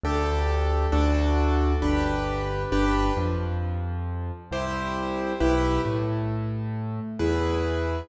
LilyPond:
<<
  \new Staff \with { instrumentName = "Acoustic Grand Piano" } { \time 3/4 \key g \major \tempo 4 = 67 <d' g' a'>4 <d' fis' a'>4 <d' g' b'>4 | <d' g' b'>8 f4. <e' g' c''>4 | <e' g' b'>8 a4. <e' gis' b'>4 | }
  \new Staff \with { instrumentName = "Acoustic Grand Piano" } { \clef bass \time 3/4 \key g \major d,4 d,4 g,,4 | g,,8 f,4. c,4 | b,,8 a,4. e,4 | }
>>